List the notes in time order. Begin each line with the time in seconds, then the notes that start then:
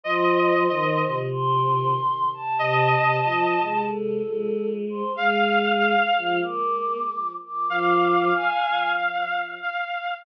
0.04 F3 C5 D#5
0.69 D#3 D#5
1.06 C3
1.31 C6
2.34 A5
2.59 C3 D#5 A5
2.97 C3
3.24 F3 D#5
3.62 G#3
3.88 A4
4.26 G#3
4.89 C5
5.15 G#3 F5
5.79 F5
6.18 F3
6.43 A#3 D6
7.45 D6
7.69 F3 F5 D6
8.34 G#5
9.63 F5